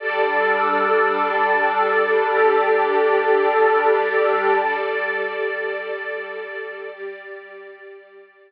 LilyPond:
<<
  \new Staff \with { instrumentName = "Pad 2 (warm)" } { \time 4/4 \key g \mixolydian \tempo 4 = 52 <g d' a'>1 | r1 | }
  \new Staff \with { instrumentName = "String Ensemble 1" } { \time 4/4 \key g \mixolydian <g a' d''>2 <g g' d''>2 | <g a' d''>2 <g g' d''>2 | }
>>